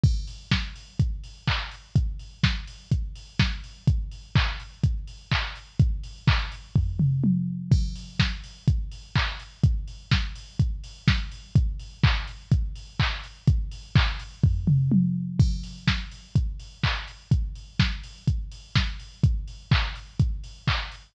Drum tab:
CC |x-------|--------|--------|--------|
HH |-o-oxo-o|xo-oxo-o|xo-oxo-o|xo-o----|
CP |------x-|--------|--x---x-|--x-----|
SD |--o-----|--o---o-|--------|--------|
T1 |--------|--------|--------|------o-|
T2 |--------|--------|--------|-----o--|
FT |--------|--------|--------|----o---|
BD |o-o-o-o-|o-o-o-o-|o-o-o-o-|o-o-o---|

CC |x-------|--------|--------|--------|
HH |-o-oxo-o|xo-oxo-o|xo-oxo-o|xo-o----|
CP |------x-|--------|--x---x-|--x-----|
SD |--o-----|--o---o-|--------|--------|
T1 |--------|--------|--------|------o-|
T2 |--------|--------|--------|-----o--|
FT |--------|--------|--------|----o---|
BD |o-o-o-o-|o-o-o-o-|o-o-o-o-|o-o-o---|

CC |x-------|--------|--------|
HH |-o-oxo-o|xo-oxo-o|xo-oxo-o|
CP |------x-|--------|--x---x-|
SD |--o-----|--o---o-|--------|
T1 |--------|--------|--------|
T2 |--------|--------|--------|
FT |--------|--------|--------|
BD |o-o-o-o-|o-o-o-o-|o-o-o-o-|